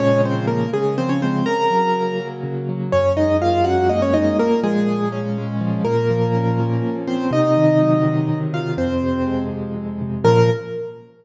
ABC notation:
X:1
M:6/8
L:1/16
Q:3/8=82
K:Bbm
V:1 name="Acoustic Grand Piano"
[Dd]2 [Cc]2 [B,B]2 [A,A]2 [Cc] [Dd] [Cc]2 | [Bb]8 z4 | [Dd]2 [Ee]2 [Ff]2 [Gg]2 [Ee] [Dd] [Ee]2 | [B,B]2 [A,A]4 z6 |
[B,B]10 [Cc]2 | [Ee]10 [Ff]2 | [Cc]6 z6 | B6 z6 |]
V:2 name="Acoustic Grand Piano"
[B,,D,F,A,]6 D,2 F,2 A,2 | D,2 G,2 B,2 G,2 D,2 G,2 | G,,2 A,2 B,2 D2 B,2 A,2 | B,,2 F,2 A,2 D2 A,2 F,2 |
B,,2 F,2 D2 F,2 B,,2 F,2 | C,2 E,2 G,2 E,2 C,2 E,2 | F,,2 C,2 A,2 C,2 F,,2 C,2 | [B,,D,F,]6 z6 |]